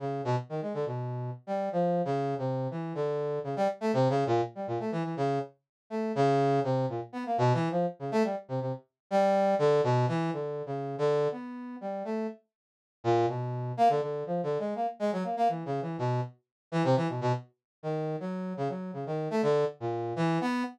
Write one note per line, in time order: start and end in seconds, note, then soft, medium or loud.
0.00 0.22 C#3 medium
0.25 0.36 B2 loud
0.49 0.60 D#3 medium
0.62 0.73 G#3 medium
0.74 0.85 D3 medium
0.86 1.30 B2 medium
1.47 1.69 G3 medium
1.72 2.02 F3 medium
2.05 2.35 C#3 medium
2.38 2.68 C3 medium
2.71 2.93 E3 medium
2.95 3.39 D3 medium
3.44 3.55 C#3 medium
3.56 3.68 G3 loud
3.81 3.92 A3 loud
3.93 4.08 C3 loud
4.09 4.24 C#3 loud
4.27 4.41 A#2 loud
4.55 4.66 G3 medium
4.67 4.78 A#2 medium
4.80 4.91 A3 medium
4.92 5.03 E3 medium
5.04 5.15 E3 medium
5.17 5.39 C#3 medium
5.90 6.12 A3 medium
6.15 6.60 C#3 loud
6.64 6.86 C3 medium
6.89 7.00 A#2 medium
7.13 7.24 B3 medium
7.26 7.37 A#3 medium
7.38 7.53 B2 loud
7.54 7.68 E3 loud
7.71 7.86 F3 medium
7.99 8.10 C#3 medium
8.12 8.23 A3 loud
8.24 8.35 G3 medium
8.48 8.60 C3 medium
8.61 8.72 C3 medium
9.11 9.55 G3 loud
9.59 9.81 D3 loud
9.84 10.06 B2 loud
10.08 10.30 E3 loud
10.33 10.62 D3 medium
10.66 10.96 C#3 medium
10.98 11.28 D3 loud
11.32 11.76 B3 medium
11.81 12.03 G3 medium
12.05 12.27 A3 medium
13.04 13.26 A#2 loud
13.28 13.72 B2 medium
13.77 13.88 A#3 loud
13.89 14.00 D3 medium
14.01 14.24 D3 medium
14.26 14.41 F3 medium
14.43 14.58 D3 medium
14.59 14.74 G#3 medium
14.75 14.86 A#3 medium
14.99 15.11 G#3 medium
15.12 15.23 F#3 medium
15.24 15.35 A#3 medium
15.37 15.48 A#3 medium
15.49 15.64 E3 medium
15.66 15.80 C#3 medium
15.82 15.97 E3 medium
15.98 16.21 B2 medium
16.72 16.83 E3 loud
16.84 16.95 C3 loud
16.96 17.07 E3 medium
17.09 17.20 B2 medium
17.21 17.32 B2 loud
17.83 18.16 D#3 medium
18.20 18.53 F#3 medium
18.57 18.68 C#3 medium
18.69 18.91 F#3 medium
18.93 19.04 C#3 medium
19.06 19.28 D#3 medium
19.31 19.42 A3 loud
19.43 19.65 D3 loud
19.80 20.13 A#2 medium
20.16 20.38 E3 loud
20.41 20.63 B3 loud